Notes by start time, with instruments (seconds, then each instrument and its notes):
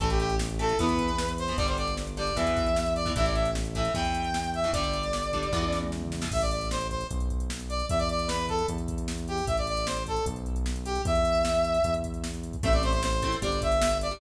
0.00 synth bass 1 A1, overdriven guitar E3 A3, brass section A4, kick, closed hi-hat
0.10 brass section G4, closed hi-hat
0.19 brass section G4, closed hi-hat
0.30 closed hi-hat
0.39 snare
0.49 closed hi-hat
0.59 overdriven guitar E3 A3, brass section A4, closed hi-hat
0.69 closed hi-hat
0.79 synth bass 1 E2, overdriven guitar E3 B3, brass section B4, kick, closed hi-hat
0.89 closed hi-hat
0.99 kick, closed hi-hat
1.09 closed hi-hat
1.18 snare
1.28 closed hi-hat
1.38 brass section C5, closed hi-hat
1.48 overdriven guitar E3 B3, closed hi-hat
1.57 synth bass 1 G1, overdriven guitar D3 G3, brass section D5, kick, closed hi-hat
1.68 brass section C5, closed hi-hat
1.77 brass section D5, closed hi-hat
1.88 closed hi-hat
1.97 snare
2.07 closed hi-hat
2.17 overdriven guitar D3 G3, brass section D5, closed hi-hat
2.27 closed hi-hat
2.36 synth bass 1 E2, overdriven guitar B2 E3, brass section E5, kick, closed hi-hat
2.47 closed hi-hat
2.57 kick, closed hi-hat
2.66 closed hi-hat
2.76 snare
2.86 closed hi-hat
2.95 brass section D5, closed hi-hat
3.06 overdriven guitar B2 E3, kick, closed hi-hat
3.16 synth bass 1 A1, overdriven guitar A2 E3, brass section E5, kick, closed hi-hat
3.25 brass section D5, closed hi-hat
3.35 brass section E5, closed hi-hat
3.45 closed hi-hat
3.55 snare
3.65 closed hi-hat
3.75 overdriven guitar A2 E3, brass section E5, kick, closed hi-hat
3.85 closed hi-hat
3.94 synth bass 1 E2, overdriven guitar B2 E3, brass section G5, kick, closed hi-hat
4.05 closed hi-hat
4.14 closed hi-hat
4.24 closed hi-hat
4.34 snare
4.44 closed hi-hat
4.54 brass section E5, closed hi-hat
4.64 overdriven guitar B2 E3, closed hi-hat
4.73 synth bass 1 G1, overdriven guitar D3 G3, brass section D5, kick, closed hi-hat
4.84 closed hi-hat
4.93 closed hi-hat
5.03 closed hi-hat
5.13 snare
5.23 closed hi-hat
5.33 overdriven guitar D3 G3, kick, closed hi-hat
5.43 closed hi-hat
5.53 synth bass 1 E2, overdriven guitar B2 E3, kick, snare
5.63 high tom
5.72 snare
5.82 mid tom
5.92 snare
6.02 floor tom
6.12 snare
6.21 overdriven guitar B2 E3, snare
6.32 synth bass 1 A1, brass section E5, kick, crash
6.41 brass section D5, closed hi-hat
6.51 brass section D5, closed hi-hat
6.61 closed hi-hat
6.71 brass section C5, snare
6.81 closed hi-hat
6.90 brass section C5, kick, closed hi-hat
7.01 closed hi-hat
7.11 synth bass 1 B1, kick, closed hi-hat
7.20 closed hi-hat
7.30 kick, closed hi-hat
7.40 closed hi-hat
7.50 snare
7.60 closed hi-hat
7.69 brass section D5, closed hi-hat
7.80 closed hi-hat
7.89 synth bass 1 E2, brass section E5, kick, closed hi-hat
7.99 brass section D5, closed hi-hat
8.09 brass section D5, closed hi-hat
8.19 closed hi-hat
8.28 brass section B4, snare
8.39 closed hi-hat
8.49 brass section A4, kick, closed hi-hat
8.59 closed hi-hat
8.68 synth bass 1 E2, kick, closed hi-hat
8.78 closed hi-hat
8.88 kick, closed hi-hat
8.98 closed hi-hat
9.08 snare
9.18 closed hi-hat
9.28 brass section G4, closed hi-hat
9.38 open hi-hat
9.47 synth bass 1 A1, brass section E5, kick, closed hi-hat
9.57 brass section D5, closed hi-hat
9.67 brass section D5, closed hi-hat
9.77 closed hi-hat
9.87 brass section C5, snare
9.97 closed hi-hat
10.07 brass section A4, kick, closed hi-hat
10.16 closed hi-hat
10.26 synth bass 1 B1, kick, closed hi-hat
10.36 closed hi-hat
10.46 closed hi-hat
10.56 closed hi-hat
10.66 snare
10.76 closed hi-hat
10.85 brass section G4, closed hi-hat
10.95 closed hi-hat
11.05 synth bass 1 E2, brass section E5, kick, closed hi-hat
11.15 closed hi-hat
11.25 closed hi-hat
11.35 closed hi-hat
11.45 snare
11.55 closed hi-hat
11.64 closed hi-hat
11.74 closed hi-hat
11.84 synth bass 1 E2, kick, closed hi-hat
11.94 closed hi-hat
12.04 kick, closed hi-hat
12.14 closed hi-hat
12.24 snare
12.34 closed hi-hat
12.43 closed hi-hat
12.53 kick, closed hi-hat
12.63 synth bass 1 A1, overdriven guitar A3 C4 E4, brass section E5, kick, closed hi-hat
12.73 brass section D5, closed hi-hat
12.83 brass section C5, closed hi-hat
12.93 brass section C5, closed hi-hat
13.03 brass section C5, snare
13.13 closed hi-hat
13.22 overdriven guitar A3 C4 E4, kick, closed hi-hat
13.32 closed hi-hat
13.42 synth bass 1 G1, overdriven guitar G3 D4, brass section D5, kick, closed hi-hat
13.52 closed hi-hat
13.62 brass section E5, kick, closed hi-hat
13.72 closed hi-hat
13.82 snare
13.91 closed hi-hat
14.01 brass section D5, closed hi-hat
14.11 overdriven guitar G3 D4, closed hi-hat